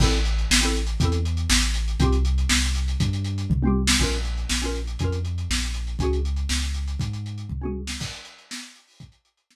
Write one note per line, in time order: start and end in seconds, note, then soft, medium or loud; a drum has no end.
0.00 0.45 A1 loud
0.00 0.17 C4 loud
0.00 0.17 E4 loud
0.00 0.17 A4 loud
0.00 kick loud
0.00 crash loud
0.12 closed hi-hat medium
0.25 closed hi-hat medium
0.38 closed hi-hat medium
0.50 0.95 A1 medium
0.50 snare loud
0.61 0.79 C4 loud
0.61 0.79 E4 medium
0.61 0.79 A4 loud
0.61 closed hi-hat medium
0.75 closed hi-hat medium
0.87 closed hi-hat medium
1.00 1.45 E2 loud
1.00 1.18 C4 medium
1.00 1.18 E4 medium
1.00 kick loud
1.00 closed hi-hat loud
1.05 1.18 A4 loud
1.12 closed hi-hat medium
1.25 closed hi-hat medium
1.37 closed hi-hat medium
1.50 1.95 A1 loud
1.50 snare loud
1.63 closed hi-hat medium
1.74 closed hi-hat loud
1.88 closed hi-hat medium
2.00 2.45 C2 loud
2.00 2.17 C4 loud
2.00 2.17 F4 loud
2.00 kick loud
2.00 closed hi-hat loud
2.04 2.17 G4 loud
2.12 closed hi-hat medium
2.25 closed hi-hat medium
2.38 closed hi-hat medium
2.49 2.95 C2 medium
2.49 snare loud
2.64 closed hi-hat medium
2.75 closed hi-hat medium
2.88 closed hi-hat medium
3.00 3.45 G2 loud
3.00 kick loud
3.00 closed hi-hat loud
3.13 closed hi-hat medium
3.24 closed hi-hat medium
3.38 closed hi-hat medium
3.50 3.95 C2 medium
3.50 kick loud
3.50 floor tom loud
3.63 3.81 C4 loud
3.63 3.81 F4 medium
3.63 mid tom loud
3.67 3.81 G4 medium
3.87 snare loud
3.99 4.45 A#1 medium
3.99 4.17 C#4 medium
3.99 4.17 F4 medium
3.99 4.17 A#4 medium
3.99 kick loud
3.99 crash loud
4.12 closed hi-hat medium
4.25 closed hi-hat medium
4.37 closed hi-hat medium
4.49 4.95 A#1 medium
4.49 snare loud
4.62 4.79 C#4 medium
4.62 4.79 F4 medium
4.62 4.79 A#4 medium
4.62 closed hi-hat medium
4.75 closed hi-hat medium
4.87 closed hi-hat medium
4.99 5.45 F2 medium
4.99 5.18 C#4 medium
4.99 5.18 F4 medium
4.99 kick loud
4.99 closed hi-hat loud
5.04 5.18 A#4 medium
5.12 closed hi-hat medium
5.25 closed hi-hat medium
5.38 closed hi-hat medium
5.50 5.95 A#1 medium
5.50 snare loud
5.63 closed hi-hat medium
5.74 closed hi-hat medium
5.87 closed hi-hat medium
5.99 6.45 C#2 medium
5.99 6.18 C#4 medium
5.99 6.18 F#4 medium
5.99 kick loud
5.99 closed hi-hat medium
6.04 6.18 G#4 medium
6.13 closed hi-hat medium
6.25 closed hi-hat medium
6.36 closed hi-hat medium
6.49 6.95 C#2 medium
6.49 snare loud
6.62 closed hi-hat medium
6.74 closed hi-hat medium
6.88 closed hi-hat medium
6.99 7.45 G#2 medium
6.99 kick medium
6.99 closed hi-hat medium
7.13 closed hi-hat medium
7.26 closed hi-hat medium
7.38 closed hi-hat medium
7.49 7.96 C#2 medium
7.49 kick medium
7.49 floor tom medium
7.62 7.79 C#4 medium
7.62 7.79 F#4 medium
7.62 7.79 G#4 medium
7.62 mid tom medium
7.87 snare loud
8.00 kick loud
8.00 crash loud
8.13 closed hi-hat medium
8.25 closed hi-hat loud
8.38 closed hi-hat medium
8.51 snare loud
8.62 closed hi-hat medium
8.76 closed hi-hat medium
8.87 open hi-hat medium
9.00 kick loud
9.00 closed hi-hat loud
9.12 closed hi-hat medium
9.25 closed hi-hat medium
9.37 closed hi-hat medium
9.51 snare loud